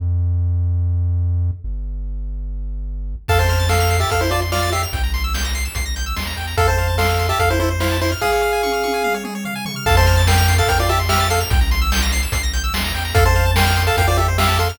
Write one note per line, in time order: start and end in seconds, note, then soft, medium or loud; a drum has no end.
0.00 1.51 F2 medium
1.64 3.15 G1 medium
3.28 4.05 F2 medium
3.28 3.39 A4 medium
3.28 3.39 F5 medium
3.28 3.38 A5 loud
3.28 kick medium
3.28 crash medium
3.39 3.67 C5 medium
3.39 3.67 A5 medium
3.39 3.48 C6 medium
3.49 3.59 F6 medium
3.49 closed hi-hat medium
3.60 3.69 A6 medium
3.69 3.97 A4 medium
3.69 3.97 F5 medium
3.69 3.79 C7 medium
3.69 snare loud
3.80 3.89 F7 medium
3.90 4.00 C7 medium
3.90 closed hi-hat medium
4.00 4.10 G4 medium
4.00 4.10 E5 medium
4.00 4.10 A6 medium
4.10 4.86 F2 medium
4.10 4.21 A4 medium
4.10 4.21 F5 medium
4.10 4.20 F6 medium
4.10 kick medium
4.10 closed hi-hat medium
4.21 4.31 E4 medium
4.21 4.31 C5 medium
4.21 4.30 C6 medium
4.31 4.40 F4 medium
4.31 4.40 D5 medium
4.31 4.41 A5 medium
4.31 closed hi-hat medium
4.42 4.51 C6 medium
4.52 4.70 F4 medium
4.52 4.70 D5 medium
4.52 4.61 F6 medium
4.52 snare loud
4.62 4.72 A6 medium
4.72 4.82 G4 soft
4.72 4.82 E5 medium
4.72 4.82 C7 medium
4.72 snare medium
4.72 closed hi-hat medium
4.83 4.92 F7 medium
4.93 5.69 C2 medium
4.93 5.02 G5 medium
4.93 kick medium
4.93 closed hi-hat medium
5.03 5.13 A#5 medium
5.14 5.23 C6 medium
5.14 closed hi-hat medium
5.24 5.33 E6 medium
5.34 5.43 G6 medium
5.34 snare loud
5.45 5.54 A#6 medium
5.54 5.64 C7 medium
5.54 closed hi-hat medium
5.65 5.74 E7 medium
5.75 6.14 C2 medium
5.75 5.85 C7 medium
5.75 kick medium
5.75 closed hi-hat medium
5.86 5.95 A#6 medium
5.96 6.05 G6 medium
5.96 closed hi-hat medium
6.06 6.15 E6 medium
6.16 6.35 D#2 medium
6.16 6.26 C6 medium
6.16 snare loud
6.27 6.36 A#5 medium
6.36 6.55 E2 medium
6.36 6.46 G5 medium
6.36 snare soft
6.36 closed hi-hat medium
6.47 6.57 A#5 medium
6.57 7.33 F2 medium
6.57 6.67 A4 medium
6.57 6.67 A4 loud
6.57 6.67 F5 medium
6.57 kick medium
6.57 closed hi-hat medium
6.67 6.96 C5 medium
6.67 6.77 C5 medium
6.67 6.96 A5 medium
6.78 6.87 F5 medium
6.78 closed hi-hat medium
6.88 6.98 A5 medium
6.98 7.27 A4 medium
6.98 7.27 F5 medium
6.98 7.08 C6 medium
6.98 snare loud
7.09 7.18 F6 medium
7.18 7.28 C6 medium
7.18 closed hi-hat medium
7.29 7.39 G4 medium
7.29 7.39 E5 medium
7.29 7.39 A5 medium
7.39 8.15 F2 medium
7.39 7.49 A4 medium
7.39 7.49 F5 medium
7.39 kick medium
7.39 closed hi-hat medium
7.50 7.59 E4 medium
7.50 7.59 C5 medium
7.60 7.69 E4 medium
7.60 7.70 A4 medium
7.60 7.69 C5 medium
7.60 closed hi-hat medium
7.71 7.80 C5 medium
7.80 7.98 E4 medium
7.80 7.98 C5 medium
7.80 7.90 F5 medium
7.80 snare loud
7.91 8.00 A5 medium
8.01 8.11 E4 medium
8.01 8.11 C5 medium
8.01 8.11 C6 medium
8.01 snare soft
8.01 closed hi-hat medium
8.12 8.21 F6 medium
8.21 9.15 G#4 medium
8.21 8.31 G#4 medium
8.21 9.15 F5 medium
8.21 kick medium
8.21 snare medium
8.32 8.41 C#5 medium
8.42 8.52 F5 medium
8.53 8.62 G#5 medium
8.63 8.72 C#6 medium
8.63 high tom medium
8.73 8.83 F6 medium
8.84 8.93 C#6 medium
8.84 high tom medium
8.94 9.03 G#5 medium
9.04 9.13 F5 medium
9.04 mid tom medium
9.14 9.24 C#5 medium
9.24 9.34 G#4 medium
9.24 mid tom medium
9.35 9.44 C#5 medium
9.45 9.54 F5 medium
9.45 floor tom medium
9.55 9.65 G#5 medium
9.65 9.75 C#6 medium
9.65 floor tom loud
9.76 9.85 F6 medium
9.86 10.62 F2 loud
9.86 9.96 A4 medium
9.86 9.96 F5 medium
9.86 9.96 A5 loud
9.86 kick loud
9.86 crash medium
9.97 10.22 C5 medium
9.97 10.22 A5 medium
9.97 10.06 C6 medium
10.06 10.16 F6 medium
10.06 closed hi-hat medium
10.17 10.26 A6 medium
10.27 10.54 A#4 medium
10.27 10.54 G5 medium
10.27 10.37 C7 medium
10.27 snare loud
10.38 10.47 F7 loud
10.48 10.57 C7 medium
10.48 closed hi-hat medium
10.58 10.68 A4 medium
10.58 10.68 F5 medium
10.58 10.67 A6 medium
10.67 11.44 F2 medium
10.67 10.79 A#4 medium
10.67 10.79 G5 medium
10.67 10.78 F6 medium
10.67 kick medium
10.67 closed hi-hat loud
10.79 10.89 F4 medium
10.79 10.89 D5 medium
10.79 10.88 C6 medium
10.89 10.99 G4 medium
10.89 10.99 E5 medium
10.89 10.98 A5 medium
10.89 closed hi-hat medium
10.99 11.09 C6 medium
11.09 11.27 G4 medium
11.09 11.27 E5 medium
11.09 11.19 F6 loud
11.09 snare loud
11.20 11.29 A6 medium
11.29 11.40 A4 medium
11.29 11.40 F5 medium
11.29 11.39 C7 medium
11.29 snare medium
11.29 closed hi-hat medium
11.40 11.50 F7 medium
11.50 12.27 C2 medium
11.50 11.60 G5 medium
11.50 kick loud
11.50 closed hi-hat loud
11.61 11.70 A#5 medium
11.71 11.80 C6 medium
11.71 closed hi-hat medium
11.82 11.91 E6 medium
11.92 12.01 G6 loud
11.92 snare loud
12.02 12.11 A#6 medium
12.12 12.22 C7 loud
12.12 closed hi-hat medium
12.23 12.32 E7 medium
12.32 12.72 C2 medium
12.32 12.42 C7 medium
12.32 kick loud
12.32 closed hi-hat loud
12.43 12.52 A#6 medium
12.53 12.63 G6 medium
12.53 closed hi-hat medium
12.64 12.73 E6 medium
12.74 12.92 D#2 medium
12.74 12.83 C6 medium
12.74 snare loud
12.84 12.93 A#5 loud
12.94 13.13 E2 medium
12.94 13.04 G5 medium
12.94 snare medium
12.94 closed hi-hat medium
13.05 13.14 A#5 medium
13.14 13.91 F2 medium
13.14 13.24 A4 medium
13.14 13.24 A4 loud
13.14 13.24 F5 medium
13.14 kick loud
13.14 closed hi-hat loud
13.25 13.35 C5 medium
13.25 13.51 C5 medium
13.25 13.51 A5 medium
13.35 13.45 F5 medium
13.35 closed hi-hat medium
13.46 13.55 A5 medium
13.56 13.83 A#4 medium
13.56 13.83 G5 medium
13.56 13.65 C6 loud
13.56 snare loud
13.66 13.76 F6 medium
13.77 13.86 C6 medium
13.77 closed hi-hat medium
13.87 13.96 A4 medium
13.87 13.96 F5 medium
13.87 13.96 A5 loud
13.97 14.73 F2 medium
13.97 14.07 A#4 medium
13.97 14.07 F5 loud
13.97 14.07 G5 medium
13.97 kick medium
13.97 closed hi-hat loud
14.08 14.17 F4 medium
14.08 14.17 C5 medium
14.08 14.17 D5 medium
14.17 14.27 G4 medium
14.17 14.27 A4 medium
14.17 14.27 E5 medium
14.17 closed hi-hat medium
14.28 14.37 C5 medium
14.38 14.58 G4 medium
14.38 14.58 E5 medium
14.38 14.48 F5 medium
14.38 snare loud
14.49 14.58 A5 medium
14.59 14.69 A4 medium
14.59 14.69 F5 medium
14.59 14.68 C6 medium
14.59 snare medium
14.59 closed hi-hat medium
14.69 14.78 F6 medium